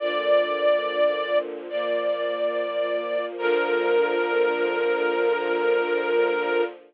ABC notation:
X:1
M:4/4
L:1/8
Q:1/4=71
K:Bb
V:1 name="String Ensemble 1"
d4 d4 | B8 |]
V:2 name="String Ensemble 1"
[B,,D,F,]4 [B,,F,B,]4 | [B,,D,F,]8 |]